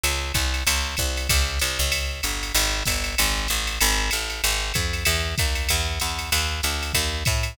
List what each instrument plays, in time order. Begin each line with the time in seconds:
0.03 electric bass (finger) C#2, ride
0.34 electric bass (finger) C2, kick, hi-hat pedal, ride
0.54 ride
0.67 electric bass (finger) C#2, ride
0.97 electric bass (finger) C2, kick, hi-hat pedal, ride
1.17 ride
1.29 electric bass (finger) C#2, kick, ride
1.59 electric bass (finger) C2, hi-hat pedal, ride
1.79 electric bass (finger) C#2, ride
1.92 ride
2.23 electric bass (finger) G1, hi-hat pedal, ride
2.43 ride
2.54 electric bass (finger) G#1, ride
2.85 electric bass (finger) G1, kick, hi-hat pedal, ride
3.04 ride
3.18 electric bass (finger) G#1, ride
3.48 electric bass (finger) A1, hi-hat pedal, ride
3.67 ride
3.80 electric bass (finger) G#1, ride
4.11 electric bass (finger) A1, hi-hat pedal, ride
4.30 ride
4.44 electric bass (finger) G#1, ride
4.74 electric bass (finger) F2, kick, hi-hat pedal, ride
4.93 ride
5.05 electric bass (finger) E2, ride
5.38 electric bass (finger) D#2, kick, hi-hat pedal, ride
5.55 ride
5.69 electric bass (finger) E2, ride
6.00 electric bass (finger) E2, hi-hat pedal, ride
6.19 ride
6.32 electric bass (finger) D#2, ride
6.63 electric bass (finger) D2, hi-hat pedal, ride
6.83 ride
6.93 electric bass (finger) D#2, kick, ride
7.25 electric bass (finger) A2, kick, hi-hat pedal, ride
7.43 ride